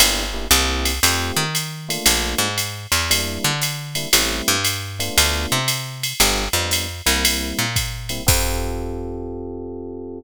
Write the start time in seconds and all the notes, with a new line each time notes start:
0.00 G1 A#3 D4 E4 G4, ride
0.34 A#3 D4 E4 G4
0.51 C2 A#3 C4 E4 G4, hi-hat pedal, ride
0.85 ride
1.03 F2 A3 C4 F4 G4, ride
1.37 D#3
1.55 hi-hat pedal, ride
1.89 A3 A#3 D4 F4, ride
2.06 A#1, ride
2.38 G#2
2.58 hi-hat pedal, ride
2.92 E2, ride
3.10 G3 A#3 D4 E4, ride
3.44 D3
3.62 hi-hat pedal, ride
3.95 G3 A#3 D4 E4, ride
4.13 A1 G3 A3 C4 E4, ride
4.48 G2
4.64 hi-hat pedal, ride
4.99 A3 B3 D4 F4, ride
5.18 D2, ride
5.52 C3
5.68 hi-hat pedal, ride
6.03 ride
6.20 G1 G3 B3 D4 F4, ride
6.53 F2 G3 B3 D4 F4
6.71 hi-hat pedal, ride
7.06 C2 G3 A#3 C4 E4, ride
7.25 ride
7.59 A#2
7.76 kick, hi-hat pedal, ride
8.09 G3 A#3 C4 E4, ride
8.27 F2 C4 F4 G4 A4, kick, crash